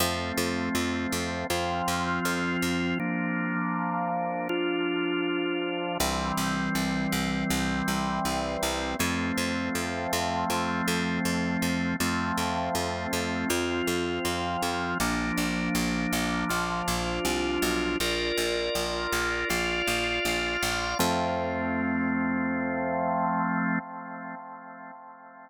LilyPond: <<
  \new Staff \with { instrumentName = "Drawbar Organ" } { \time 4/4 \key f \major \tempo 4 = 80 <f a c'>2 <f c' f'>2 | <f bes d'>2 <f d' f'>2 | <e g c'>1 | <f a c'>1 |
<f a c'>2 <f c' f'>2 | <f bes d'>2 <f d' f'>2 | <f' bes' d''>2 <f' d'' f''>2 | <f a c'>1 | }
  \new Staff \with { instrumentName = "Electric Bass (finger)" } { \clef bass \time 4/4 \key f \major f,8 f,8 f,8 f,8 f,8 f,8 f,8 f,8 | r1 | c,8 c,8 c,8 c,8 c,8 c,8 c,8 c,8 | f,8 f,8 f,8 f,8 f,8 f,8 f,8 f,8 |
f,8 f,8 f,8 f,8 f,8 f,8 f,8 f,8 | bes,,8 bes,,8 bes,,8 bes,,8 bes,,8 bes,,8 c,8 b,,8 | bes,,8 bes,,8 bes,,8 bes,,8 bes,,8 bes,,8 bes,,8 bes,,8 | f,1 | }
>>